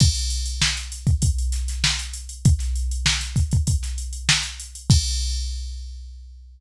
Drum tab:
CC |x---------------|----------------|x---------------|
HH |-xxx-xxxxxxx-xxx|xxxx-xxxxxxx-xxx|----------------|
SD |----o-----ooo---|-o--oo---o--o---|----------------|
BD |o------oo-------|o-----ooo-------|o---------------|